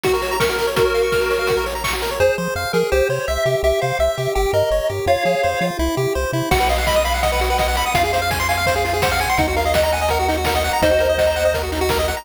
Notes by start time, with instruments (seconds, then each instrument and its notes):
0.04 lead 1 (square) F#4, kick, closed hi-hat
0.13 lead 1 (square) A#4, closed hi-hat
0.22 lead 1 (square) C#5, open hi-hat
0.31 lead 1 (square) A#5, closed hi-hat
0.40 lead 1 (square) A#4 C#6, kick, snare
0.49 lead 1 (square) F#4, closed hi-hat
0.58 lead 1 (square) A#4, open hi-hat
0.67 lead 1 (square) C#5, closed hi-hat
0.76 lead 1 (square) F#4 A#4, kick, closed hi-hat
0.85 lead 1 (square) C#5, closed hi-hat
0.94 lead 1 (square) F5, open hi-hat
1.03 lead 1 (square) C#6, closed hi-hat
1.12 lead 1 (square) F6, kick, snare
1.21 lead 1 (square) A#4, closed hi-hat
1.30 lead 1 (square) C#5, open hi-hat
1.39 lead 1 (square) F5, closed hi-hat
1.47 lead 1 (square) F#4, kick, closed hi-hat
1.57 lead 1 (square) A#4, closed hi-hat
1.66 lead 1 (square) C#5, open hi-hat
1.75 lead 1 (square) A#5, closed hi-hat
1.84 lead 1 (square) C#6, kick, clap
1.93 lead 1 (square) F#4, closed hi-hat
2.02 lead 1 (square) A#4, open hi-hat
2.11 lead 1 (square) C#5, closed hi-hat
2.20 synth bass 1 F2, lead 1 (square) G#4 C5
2.38 synth bass 1 F3, lead 1 (square) C5
2.56 synth bass 1 F2, lead 1 (square) F5
2.73 synth bass 1 F3, lead 1 (square) G#4 A#4
2.92 synth bass 1 C2, lead 1 (square) G4 C5
3.09 synth bass 1 C3, lead 1 (square) C5 C#5
3.28 synth bass 1 C2, lead 1 (square) E5
3.46 synth bass 1 C3, lead 1 (square) G4
3.63 synth bass 1 C2, lead 1 (square) G4 E5
3.81 synth bass 1 C3, lead 1 (square) C5 F5
3.99 synth bass 1 C2, lead 1 (square) E5
4.18 synth bass 1 C3, lead 1 (square) G4
4.35 synth bass 1 G1, lead 1 (square) G4 G5
4.53 synth bass 1 G2, lead 1 (square) A#4 D#5
4.71 synth bass 1 G1, lead 1 (square) C#5
4.89 synth bass 1 G2, lead 1 (square) G4
5.06 synth bass 1 F2, lead 1 (square) F4 C#5 F5
5.25 synth bass 1 F3, lead 1 (square) G#4
5.43 synth bass 1 F2, lead 1 (square) C5
5.61 synth bass 1 F3, lead 1 (square) F4
5.79 synth bass 1 C2, lead 1 (square) E4
5.97 synth bass 1 C3, lead 1 (square) G4
6.15 synth bass 1 C2, lead 1 (square) C5
6.33 synth bass 1 C3, lead 1 (square) E4
6.51 synth bass 1 B1, lead 1 (square) F#4 F#5, kick, crash
6.60 lead 1 (square) B4, closed hi-hat
6.69 lead 1 (square) D#5 F5, open hi-hat
6.78 lead 1 (square) F#5, closed hi-hat
6.87 lead 1 (square) D#5 B5, kick, snare
6.94 lead 1 (square) D#6, closed hi-hat
7.04 lead 1 (square) F5 B5, open hi-hat
7.14 lead 1 (square) F#5, closed hi-hat
7.23 lead 1 (square) D#5 F#5, kick, closed hi-hat
7.32 lead 1 (square) B4, closed hi-hat
7.39 lead 1 (square) F#4, open hi-hat
7.50 lead 1 (square) B4, closed hi-hat
7.58 lead 1 (square) D#5 F#5, kick, snare
7.68 lead 1 (square) F#5, closed hi-hat
7.75 lead 1 (square) B5, open hi-hat
7.85 lead 1 (square) D#6, closed hi-hat
7.94 synth bass 1 F2, lead 1 (square) F4 F5, kick, closed hi-hat
8.04 lead 1 (square) G#4, closed hi-hat
8.13 lead 1 (square) C5 F5, open hi-hat
8.21 lead 1 (square) F5, closed hi-hat
8.31 lead 1 (square) G#5, kick, snare
8.40 lead 1 (square) C6, closed hi-hat
8.49 lead 1 (square) F5 G#5, open hi-hat
8.57 lead 1 (square) F5, closed hi-hat
8.66 lead 1 (square) C5, kick, closed hi-hat
8.76 lead 1 (square) G#4, closed hi-hat
8.85 lead 1 (square) F4, open hi-hat
8.93 lead 1 (square) G#4, closed hi-hat
9.02 lead 1 (square) C5 F#5, kick, snare
9.12 lead 1 (square) F5, closed hi-hat
9.19 lead 1 (square) G#5, open hi-hat
9.29 lead 1 (square) C6, closed hi-hat
9.37 synth bass 1 D#2, lead 1 (square) D#4 F#5, kick, closed hi-hat
9.48 lead 1 (square) F#4, closed hi-hat
9.56 lead 1 (square) A#4 F5, open hi-hat
9.66 lead 1 (square) D#5, closed hi-hat
9.74 lead 1 (square) D#5 F#5, kick, snare
9.82 lead 1 (square) A#5, closed hi-hat
9.92 lead 1 (square) F#5 G#5, open hi-hat
10.00 lead 1 (square) D#5, closed hi-hat
10.09 lead 1 (square) A#4 F#5, kick, closed hi-hat
10.19 lead 1 (square) F#4, closed hi-hat
10.28 lead 1 (square) D#4, open hi-hat
10.37 lead 1 (square) F#4, closed hi-hat
10.45 lead 1 (square) A#4 F#5, kick, snare
10.55 lead 1 (square) D#5, closed hi-hat
10.64 lead 1 (square) F#5, open hi-hat
10.73 lead 1 (square) A#5, closed hi-hat
10.82 synth bass 1 D#2, lead 1 (square) D#4 C5 D#5, kick, closed hi-hat
10.91 lead 1 (square) F#4, closed hi-hat
10.99 lead 1 (square) A#4, open hi-hat
11.08 lead 1 (square) D#5, closed hi-hat
11.18 lead 1 (square) F#5, kick, snare
11.26 lead 1 (square) A#5, closed hi-hat
11.36 lead 1 (square) F#5, open hi-hat
11.44 lead 1 (square) D#5, closed hi-hat
11.54 lead 1 (square) A#4, kick, closed hi-hat
11.62 lead 1 (square) F#4, closed hi-hat
11.72 lead 1 (square) D#4, open hi-hat
11.80 lead 1 (square) F#4, closed hi-hat
11.89 lead 1 (square) A#4, kick, snare
11.99 lead 1 (square) D#5, closed hi-hat
12.08 lead 1 (square) F#5, open hi-hat
12.16 lead 1 (square) A#5, closed hi-hat